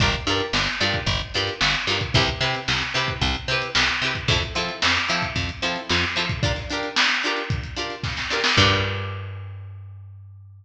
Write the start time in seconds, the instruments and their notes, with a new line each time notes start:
0.00 electric bass (finger) G1, pizzicato strings D4 F4 G4 A#4, kick, closed hi-hat
0.14 closed hi-hat
0.27 electric bass (finger) G2, pizzicato strings D4 F4 G4 A#4, closed hi-hat
0.40 closed hi-hat
0.53 electric bass (finger) G1, snare
0.67 snare, closed hi-hat
0.80 electric bass (finger) G2, pizzicato strings D4 F4 G4 A#4, closed hi-hat
0.94 kick, closed hi-hat
1.06 electric bass (finger) G1, kick, closed hi-hat
1.20 closed hi-hat
1.34 electric bass (finger) G2, pizzicato strings D4 F4 G4 A#4, snare, closed hi-hat
1.47 closed hi-hat
1.61 electric bass (finger) G1, snare
1.74 closed hi-hat
1.87 electric bass (finger) G2, pizzicato strings D4 F4 G4 A#4, closed hi-hat
2.01 kick, closed hi-hat
2.14 electric bass (finger) C2, pizzicato strings C4 E4 G4 B4, kick, closed hi-hat
2.28 closed hi-hat
2.41 electric bass (finger) C3, pizzicato strings C4 E4 G4 B4, closed hi-hat
2.54 snare, closed hi-hat
2.68 electric bass (finger) C2, snare
2.81 snare, closed hi-hat
2.94 electric bass (finger) C3, pizzicato strings C4 E4 G4 B4, closed hi-hat
3.08 kick, closed hi-hat
3.21 electric bass (finger) C2, kick, closed hi-hat
3.35 closed hi-hat
3.48 electric bass (finger) C3, pizzicato strings C4 E4 G4, closed hi-hat
3.52 pizzicato strings B4
3.62 closed hi-hat
3.75 electric bass (finger) C2, snare
3.88 snare, closed hi-hat
4.02 electric bass (finger) C3, pizzicato strings C4 E4 G4, closed hi-hat
4.06 pizzicato strings B4
4.15 kick, closed hi-hat
4.28 electric bass (finger) F2, pizzicato strings C4 E4 F4 A4, kick, closed hi-hat
4.42 closed hi-hat
4.55 electric bass (finger) F3, pizzicato strings C4 E4 F4 A4, snare, closed hi-hat
4.69 closed hi-hat
4.82 electric bass (finger) F2, snare
4.95 snare, closed hi-hat
5.08 electric bass (finger) F3, pizzicato strings C4 E4 F4 A4, snare, closed hi-hat
5.22 kick, closed hi-hat
5.36 electric bass (finger) F2, kick, closed hi-hat
5.49 closed hi-hat
5.62 electric bass (finger) F3, pizzicato strings C4 E4 F4 A4, closed hi-hat
5.76 closed hi-hat
5.89 electric bass (finger) F2, snare
6.03 closed hi-hat
6.16 electric bass (finger) F3, pizzicato strings C4 E4 F4 A4, closed hi-hat
6.29 kick, closed hi-hat
6.43 pizzicato strings D4 F4 G4 A#4, kick, closed hi-hat
6.56 snare, closed hi-hat
6.70 pizzicato strings D4 F4 G4 A#4, closed hi-hat
6.83 closed hi-hat
6.96 snare
7.10 snare, closed hi-hat
7.23 pizzicato strings D4 F4 G4 A#4, closed hi-hat
7.37 closed hi-hat
7.50 kick, closed hi-hat
7.63 closed hi-hat
7.76 pizzicato strings D4 F4 G4 A#4, closed hi-hat
7.90 closed hi-hat
8.03 kick, snare
8.17 snare
8.30 pizzicato strings D4 F4 G4 A#4, snare
8.44 snare
8.57 electric bass (finger) G2, pizzicato strings D4 F4 G4 A#4, kick, crash